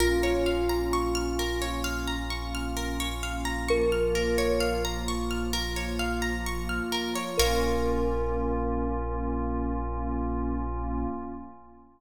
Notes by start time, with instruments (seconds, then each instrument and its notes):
0.00 synth bass 2 A#1, pad 5 (bowed) A#3 C#4 F4, kalimba F4, orchestral harp A#4
0.23 orchestral harp C#5
0.46 orchestral harp F5
0.69 orchestral harp A#5
0.93 orchestral harp C#6
1.15 orchestral harp F6
1.39 orchestral harp A#4
1.62 orchestral harp C#5
1.84 orchestral harp F5
2.08 orchestral harp A#5
2.30 orchestral harp C#6
2.55 orchestral harp F6
2.77 orchestral harp A#4
3.00 orchestral harp C#5
3.23 orchestral harp F5
3.45 orchestral harp A#5
3.68 pad 5 (bowed) F3 A#3 F4, kalimba A#4, orchestral harp C#6
3.92 orchestral harp F6
4.15 orchestral harp A#4
4.38 orchestral harp C#5
4.60 orchestral harp F5
4.85 orchestral harp A#5
5.08 orchestral harp C#6
5.31 orchestral harp F6
5.53 orchestral harp A#4
5.76 orchestral harp C#5
5.99 orchestral harp F5
6.22 orchestral harp A#5
6.46 orchestral harp C#6
6.69 orchestral harp F6
6.92 orchestral harp A#4
7.15 orchestral harp C#5
7.37 synth bass 2 A#1, pad 5 (bowed) A#3 C#4 F4, kalimba A#4, orchestral harp A#4 C#5 F5